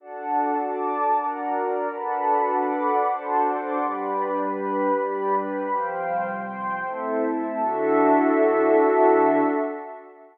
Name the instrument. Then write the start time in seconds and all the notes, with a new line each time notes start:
pad 2 (warm)
0.00 D4 F#4 A4 D5 F#5 A5
0.56 D5 A5 D6
1.13 D4 F#4 A#4 D5 F#5 A#5
1.50 A#4 D5 A#5
1.89 D4 F#4 A4 B4 D5 F#5 A5 B5
2.48 D5 F#5 B5 D6
3.03 D4 F#4 A4 C5 D5 F#5 A5 C6
3.42 D5 F#5 C6 D6
3.78 G3 D4 G4 B4 D5 B5
4.37 G4 B4 B5
4.92 G3 D4 G4 B4 D5 B5
5.31 G4 B4 B5
5.70 C3 F3 G3 C5 F5 G5
6.27 C5 G5 C6
6.84 A3 C4 E4 A4 C5 E5
7.23 A4 E5 A5
7.58 D3 D4 E4 F#4 A4 E5